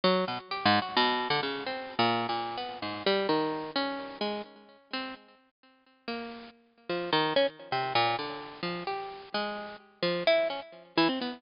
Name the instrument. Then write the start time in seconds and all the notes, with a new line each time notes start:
harpsichord
0.04 F#3
0.28 B2
0.51 G4
0.65 G#2
0.82 F#4
0.97 B2
1.30 D3
1.43 C#3
1.66 C4
1.99 A#2
2.29 A#2
2.57 B3
2.82 G#2
3.06 G3
3.29 D#3
3.76 C#4
4.21 G#3
4.93 C4
6.08 A#3
6.89 F3
7.12 D#3
7.36 C#4
7.72 C3
7.95 A#2
8.19 D3
8.63 F3
8.87 G4
9.34 G#3
10.03 F3
10.27 E4
10.50 C#4
10.97 E3
11.09 C4
11.21 B3